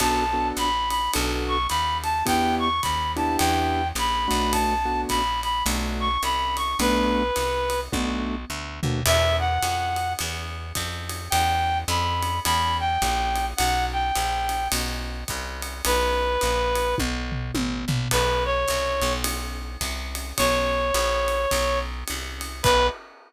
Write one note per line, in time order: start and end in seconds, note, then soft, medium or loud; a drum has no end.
0.00 0.52 B1 medium
0.00 0.24 B3 medium
0.00 0.24 D4 medium
0.00 0.24 F#4 loud
0.00 0.24 A4 medium
0.00 0.48 A5 medium
0.00 kick medium
0.00 crash medium
0.00 ride loud
0.33 0.69 B3 medium
0.33 0.69 D4 medium
0.33 0.69 F#4 medium
0.33 0.69 A4 medium
0.57 1.09 A#1 medium
0.57 0.89 B5 medium
0.57 hi-hat pedal medium
0.57 ride medium
0.90 1.11 B5 medium
0.90 ride medium
1.13 1.67 B1 loud
1.13 1.57 B3 medium
1.13 1.57 D4 medium
1.13 1.57 F#4 loud
1.13 1.57 A4 medium
1.13 ride loud
1.48 1.67 C#6 medium
1.69 2.23 D#2 medium
1.69 1.97 B5 medium
1.69 hi-hat pedal medium
1.69 ride medium
2.03 2.24 A5 medium
2.03 ride medium
2.26 2.81 E2 medium
2.26 2.69 B3 loud
2.26 2.69 D4 medium
2.26 2.69 E4 medium
2.26 2.69 G4 medium
2.26 2.55 G5 medium
2.26 kick medium
2.26 ride loud
2.59 2.81 C#6 medium
2.82 3.37 D#2 medium
2.82 3.12 B5 medium
2.82 kick medium
2.82 hi-hat pedal medium
2.82 ride medium
3.16 3.82 B3 medium
3.16 3.82 D4 medium
3.16 3.82 E4 medium
3.16 3.82 G4 medium
3.16 3.36 A5 medium
3.16 ride medium
3.38 3.93 E2 loud
3.38 3.88 G5 medium
3.38 ride loud
3.95 4.27 A#1 medium
3.95 4.53 B5 medium
3.95 hi-hat pedal medium
3.95 ride medium
4.28 5.06 B1 medium
4.28 4.74 A3 medium
4.28 4.74 B3 medium
4.28 4.74 D4 medium
4.28 4.74 F#4 medium
4.28 ride medium
4.52 5.01 A5 medium
4.52 kick medium
4.52 ride loud
4.85 5.22 A3 medium
4.85 5.22 B3 medium
4.85 5.22 D4 medium
4.85 5.22 F#4 medium
5.09 5.63 A#1 medium
5.09 5.40 B5 medium
5.09 kick medium
5.09 hi-hat pedal medium
5.09 ride medium
5.43 5.64 B5 medium
5.43 ride medium
5.66 6.18 B1 loud
5.66 6.09 A3 medium
5.66 6.09 B3 medium
5.66 6.09 D4 medium
5.66 6.09 F#4 medium
5.66 ride loud
6.00 6.22 C#6 medium
6.23 6.75 C2 medium
6.23 6.56 B5 medium
6.23 hi-hat pedal medium
6.23 ride medium
6.57 6.77 C#6 medium
6.57 ride medium
6.79 7.31 B1 loud
6.79 7.23 A3 loud
6.79 7.23 B3 medium
6.79 7.23 D4 loud
6.79 7.23 F#4 medium
6.79 7.80 B4 medium
6.79 ride loud
7.36 7.89 C2 medium
7.36 hi-hat pedal medium
7.36 ride medium
7.70 ride medium
7.92 8.45 B1 loud
7.92 8.35 A3 medium
7.92 8.35 B3 medium
7.92 8.35 D4 loud
7.92 8.35 F#4 medium
7.92 kick medium
7.92 high tom medium
8.50 8.80 D2 medium
8.83 9.03 D#2 medium
8.83 9.00 A3 medium
8.83 9.00 B3 medium
8.83 9.00 D4 medium
8.83 9.00 F#4 medium
8.83 floor tom loud
9.06 9.58 E2 loud
9.06 9.36 E5 medium
9.06 crash loud
9.06 ride loud
9.39 10.13 F#5 medium
9.63 10.15 F2 medium
9.63 hi-hat pedal medium
9.63 ride medium
9.96 ride medium
10.19 10.73 E2 loud
10.19 ride loud
10.75 11.29 F2 loud
10.75 kick medium
10.75 hi-hat pedal medium
10.75 ride medium
11.09 ride medium
11.30 11.84 E2 loud
11.30 11.78 G5 medium
11.30 ride loud
11.88 12.40 F2 loud
11.88 12.39 B5 medium
11.88 hi-hat pedal medium
11.88 ride medium
12.23 ride medium
12.45 12.98 E2 loud
12.45 12.77 B5 medium
12.45 ride loud
12.80 13.46 G5 medium
13.02 13.54 A#1 loud
13.02 kick medium
13.02 hi-hat pedal medium
13.02 ride medium
13.35 ride medium
13.57 14.12 B1 loud
13.57 13.85 F#5 medium
13.57 ride loud
13.93 14.68 G5 medium
14.15 14.68 A#1 medium
14.15 hi-hat pedal medium
14.15 ride medium
14.49 ride medium
14.72 15.24 B1 loud
14.72 ride loud
15.28 15.82 C2 medium
15.28 kick medium
15.28 hi-hat pedal medium
15.28 ride medium
15.62 ride medium
15.85 16.38 B1 loud
15.85 16.95 B4 medium
15.85 ride loud
16.41 16.95 A#1 medium
16.41 hi-hat pedal medium
16.41 ride medium
16.75 ride medium
16.98 17.52 B1 loud
16.98 kick medium
16.98 high tom medium
17.32 floor tom medium
17.54 17.85 A1 medium
17.54 high tom loud
17.88 18.08 A#1 medium
17.88 floor tom loud
18.11 18.65 B1 loud
18.11 18.44 B4 medium
18.11 kick medium
18.11 crash loud
18.11 ride medium
18.45 19.13 C#5 medium
18.68 19.02 C2 medium
18.68 hi-hat pedal medium
18.68 ride medium
19.02 19.77 B1 loud
19.02 ride medium
19.24 ride loud
19.81 20.33 C2 medium
19.81 kick medium
19.81 hi-hat pedal medium
19.81 ride medium
20.15 ride medium
20.38 20.92 B1 loud
20.38 21.79 C#5 medium
20.38 kick medium
20.38 ride loud
20.94 21.46 A#1 loud
20.94 hi-hat pedal medium
20.94 ride medium
21.28 ride medium
21.51 22.04 B1 loud
21.51 kick medium
21.51 ride loud
22.08 22.62 C2 medium
22.08 hi-hat pedal medium
22.08 ride medium
22.41 ride medium
22.63 22.89 B1 loud
22.63 22.87 B4 loud
22.63 kick loud
22.63 crash loud